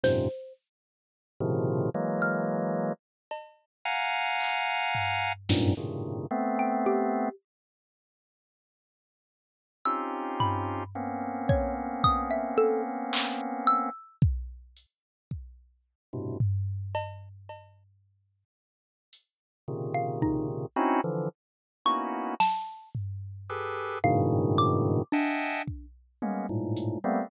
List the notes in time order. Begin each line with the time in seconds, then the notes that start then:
0.03 F#2 G#2 A#2 C3 C5, snare
1.40 A2 B2 C3 C#3 D#3 F3
1.94 E3 F#3 G#3 A#3
2.22 F6
3.31 cowbell
3.85 F5 F#5 G#5 A#5
4.40 clap
4.95 floor tom
5.49 F#2 G2 G#2 A#2, snare
5.77 G2 A2 A#2 C3 C#3 D#3
6.31 A3 B3 C4
6.59 G5
6.86 G4
9.85 C4 C#4 D#4 F4 G4 E6
10.40 B5, floor tom
10.95 A#3 B3 C4 C#4
11.49 C#5, kick
12.04 D#6, kick
12.31 E5
12.58 A4
13.13 clap
13.67 E6
14.22 kick
14.77 closed hi-hat
15.31 kick
16.13 G2 A2 B2 C3
16.40 floor tom
16.95 cowbell
17.49 cowbell
19.13 closed hi-hat
19.68 A#2 C3 C#3 D#3
19.95 F5
20.22 D#4, kick
20.76 C4 C#4 D#4 E4 F#4
21.04 D3 E3 F3
21.85 A#3 B3 C#4 D#4 E4 F#4 C#6
22.40 A5, snare
22.95 floor tom
23.50 G4 G#4 A4 B4
24.04 G2 G#2 A2 B2 C#3 D#3 F5
24.58 D6
25.12 D4 D#5 E5 F#5 G5 G#5 A5
25.67 kick
26.22 G#3 A#3 B3 C#4, high tom
26.49 G#2 A2 A#2
26.77 closed hi-hat
27.04 G3 A3 A#3 B3 C4